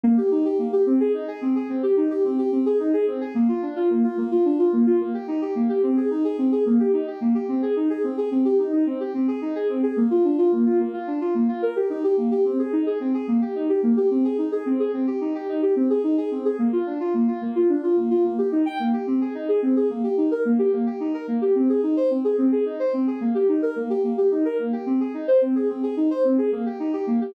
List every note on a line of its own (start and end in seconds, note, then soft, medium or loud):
0.04 0.16 A#3 loud
0.17 0.30 G4 medium
0.31 0.44 D#4 medium
0.45 0.58 G4 medium
0.59 0.71 A#3 medium
0.72 0.85 G4 medium
0.86 0.99 C4 loud
1.00 1.13 G#4 loud
1.14 1.27 D#4 medium
1.28 1.40 G#4 loud
1.41 1.54 C4 medium
1.55 1.68 G#4 medium
1.69 1.82 C4 medium
1.83 1.96 G4 medium
1.97 2.09 D#4 medium
2.10 2.23 G4 medium
2.24 2.37 C4 medium
2.38 2.51 G4 medium
2.52 2.64 C4 medium
2.66 2.78 G#4 medium
2.79 2.92 D#4 medium
2.93 3.06 G#4 loud
3.07 3.20 C4 medium
3.21 3.34 G#4 medium
3.35 3.47 A#3 loud
3.48 3.61 F4 medium
3.62 3.75 D4 medium
3.76 3.89 F4 loud
3.90 4.02 A#3 medium
4.04 4.16 F4 medium
4.17 4.30 A#3 loud
4.31 4.44 F4 medium
4.45 4.58 D4 medium
4.59 4.71 F4 medium
4.73 4.85 A#3 medium
4.86 4.99 F4 medium
5.00 5.13 A#3 medium
5.14 5.27 G4 medium
5.28 5.40 D#4 medium
5.41 5.54 G4 medium
5.55 5.68 A#3 medium
5.69 5.82 G4 medium
5.83 5.96 C4 loud
5.97 6.09 G#4 medium
6.10 6.23 D#4 medium
6.24 6.37 G#4 medium
6.38 6.51 C4 medium
6.52 6.64 G#4 medium
6.66 6.78 A#3 medium
6.79 6.92 G4 medium
6.93 7.06 D#4 medium
7.07 7.20 G4 medium
7.21 7.34 A#3 medium
7.35 7.47 G4 medium
7.48 7.61 C4 medium
7.62 7.75 G#4 medium
7.76 7.89 D#4 medium
7.90 8.02 G#4 medium
8.04 8.16 C4 medium
8.17 8.30 G#4 medium
8.31 8.44 C4 medium
8.45 8.58 G4 medium
8.59 8.71 D#4 medium
8.73 8.85 D#4 medium
8.86 8.99 C4 medium
9.00 9.13 G4 medium
9.14 9.27 C4 medium
9.28 9.40 G#4 medium
9.41 9.54 D#4 medium
9.55 9.68 G#4 medium
9.69 9.82 C4 medium
9.83 9.96 G#4 medium
9.97 10.09 A#3 medium
10.10 10.23 F4 medium
10.24 10.37 D4 medium
10.38 10.51 F4 medium
10.52 10.65 A#3 medium
10.66 10.78 F4 medium
10.79 10.92 A#3 medium
10.93 11.06 F4 medium
11.07 11.20 D4 medium
11.21 11.34 F4 medium
11.35 11.47 A#3 medium
11.48 11.61 F4 medium
11.62 11.75 A#4 medium
11.76 11.89 G4 medium
11.90 12.02 D#4 medium
12.04 12.16 G4 medium
12.17 12.30 A#3 medium
12.31 12.44 G4 medium
12.45 12.58 C4 medium
12.59 12.71 G#4 medium
12.73 12.85 D#4 medium
12.86 12.99 G#4 medium
13.00 13.13 C4 medium
13.14 13.27 G#4 medium
13.28 13.40 A#3 medium
13.41 13.54 G4 medium
13.55 13.68 D#4 medium
13.69 13.82 G4 medium
13.83 13.96 A#3 medium
13.97 14.09 G4 medium
14.10 14.23 C4 medium
14.24 14.37 G#4 medium
14.38 14.51 D#4 medium
14.52 14.64 G#4 medium
14.66 14.78 C4 medium
14.79 14.92 G#4 medium
14.93 15.06 C4 medium
15.07 15.20 G4 medium
15.21 15.33 D#4 medium
15.35 15.47 G4 medium
15.48 15.61 D#4 medium
15.62 15.75 G4 medium
15.76 15.89 C4 medium
15.90 16.02 G#4 medium
16.04 16.16 D#4 medium
16.17 16.30 G#4 medium
16.31 16.44 C4 medium
16.45 16.58 G#4 medium
16.59 16.71 A#3 medium
16.73 16.85 F4 medium
16.86 16.99 D4 medium
17.00 17.13 F4 medium
17.14 17.27 A#3 medium
17.28 17.40 F4 medium
17.41 17.54 A#3 medium
17.55 17.68 F4 medium
17.69 17.82 D4 medium
17.83 17.96 F4 medium
17.97 18.09 A#3 medium
18.10 18.23 F4 medium
18.24 18.37 A#3 medium
18.38 18.51 G4 medium
18.52 18.64 D#4 medium
18.66 18.78 G5 medium
18.79 18.92 A#3 medium
18.93 19.06 G4 medium
19.07 19.20 C4 medium
19.21 19.34 G#4 medium
19.35 19.47 D#4 medium
19.48 19.61 G#4 medium
19.62 19.75 C4 medium
19.76 19.89 G#4 medium
19.90 20.02 A#3 medium
20.04 20.16 G4 medium
20.17 20.30 D#4 medium
20.31 20.44 A#4 medium
20.45 20.58 A#3 medium
20.59 20.71 G4 medium
20.73 20.85 A#3 medium
20.86 20.99 G4 medium
21.00 21.13 D#4 medium
21.14 21.27 A#4 medium
21.28 21.40 A#3 medium
21.41 21.54 G4 medium
21.55 21.68 C4 medium
21.69 21.82 G#4 medium
21.83 21.96 D#4 medium
21.97 22.09 C5 medium
22.10 22.23 C4 medium
22.24 22.37 G#4 medium
22.38 22.51 C4 medium
22.52 22.65 G#4 medium
22.66 22.78 D#4 medium
22.79 22.92 C5 medium
22.93 23.06 C4 medium
23.07 23.20 G#4 medium
23.21 23.34 A#3 medium
23.35 23.47 G4 medium
23.48 23.61 D#4 medium
23.62 23.75 A#4 medium
23.76 23.89 A#3 medium
23.90 24.02 G4 medium
24.04 24.16 A#3 medium
24.17 24.30 G4 medium
24.31 24.44 D#4 medium
24.45 24.58 A#4 medium
24.59 24.71 A#3 medium
24.73 24.85 G4 medium
24.86 24.99 C4 medium
25.00 25.13 G#4 medium
25.14 25.27 D#4 medium
25.28 25.40 C5 medium
25.41 25.54 C4 medium
25.55 25.68 G#4 medium
25.69 25.82 C4 medium
25.83 25.96 G#4 medium
25.97 26.09 D#4 medium
26.10 26.23 C5 medium
26.24 26.37 C4 medium
26.38 26.51 G#4 medium
26.52 26.65 A#3 medium
26.66 26.78 G4 medium
26.79 26.92 D#4 medium
26.93 27.06 G4 medium
27.07 27.20 A#3 medium
27.21 27.34 G4 medium